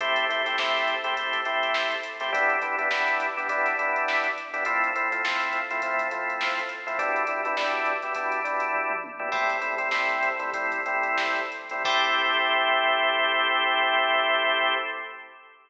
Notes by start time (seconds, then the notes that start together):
0.00 A3 C4 E4 G4, kick, closed hi-hat
0.16 closed hi-hat
0.29 A3 C4 E4 G4, closed hi-hat
0.46 A3 C4 E4 G4, snare, closed hi-hat
0.58 A3 C4 E4 G4, snare
0.76 snare
0.87 snare, closed hi-hat
1.04 A3 C4 E4 G4, closed hi-hat
1.17 A3 C4 E4 G4, kick, closed hi-hat
1.33 kick, closed hi-hat
1.45 A3 C4 E4 G4, closed hi-hat
1.63 closed hi-hat
1.74 snare
1.91 snare, closed hi-hat
2.03 closed hi-hat
2.20 A3 C4 E4 G4, snare, closed hi-hat
2.32 G3 B3 D4 E4, kick, closed hi-hat
2.50 closed hi-hat
2.62 G3 B3 D4 E4, closed hi-hat
2.79 G3 B3 D4 E4, closed hi-hat
2.91 G3 B3 D4 E4, snare
3.08 closed hi-hat
3.20 closed hi-hat
3.37 G3 B3 D4 E4, closed hi-hat
3.48 G3 B3 D4 E4, kick, closed hi-hat
3.66 kick, snare, closed hi-hat
3.79 G3 B3 D4 E4, closed hi-hat
3.96 closed hi-hat
4.08 snare
4.24 closed hi-hat
4.38 closed hi-hat
4.54 G3 B3 D4 E4, closed hi-hat
4.65 F3 A3 C4 E4, kick, closed hi-hat
4.84 closed hi-hat
4.96 F3 A3 C4 E4, closed hi-hat
5.12 F3 A3 C4 E4, closed hi-hat
5.24 F3 A3 C4 E4, snare
5.40 closed hi-hat
5.53 closed hi-hat
5.71 F3 A3 C4 E4, closed hi-hat
5.82 F3 A3 C4 E4, kick, closed hi-hat
5.98 kick, closed hi-hat
6.11 F3 A3 C4 E4, closed hi-hat
6.30 closed hi-hat
6.41 snare
6.59 closed hi-hat
6.69 closed hi-hat
6.87 F3 A3 C4 E4, closed hi-hat
6.99 B2 G3 D4 E4, kick, closed hi-hat
7.16 closed hi-hat
7.27 B2 G3 D4 E4, closed hi-hat
7.45 B2 G3 D4 E4, closed hi-hat
7.57 B2 G3 D4 E4, snare
7.86 closed hi-hat
8.02 B2 G3 D4 E4, closed hi-hat
8.15 B2 G3 D4 E4, kick, closed hi-hat
8.32 kick, closed hi-hat
8.44 B2 G3 D4 E4, closed hi-hat
8.60 closed hi-hat
8.74 kick, floor tom
8.90 mid tom
9.04 high tom
9.19 B2 G3 D4 E4
9.32 A2 G3 C4 E4, kick, crash
9.49 snare, closed hi-hat
9.61 A2 G3 C4 E4, closed hi-hat
9.78 A2 G3 C4 E4, closed hi-hat
9.91 A2 G3 C4 E4, snare
10.10 closed hi-hat
10.23 closed hi-hat
10.39 A2 G3 C4 E4, closed hi-hat
10.53 A2 G3 C4 E4, kick, closed hi-hat
10.72 kick, closed hi-hat
10.86 A2 G3 C4 E4, closed hi-hat
11.03 closed hi-hat
11.18 snare
11.36 closed hi-hat
11.52 closed hi-hat
11.69 A2 G3 C4 E4, closed hi-hat
11.85 A3 C4 E4 G4, kick, crash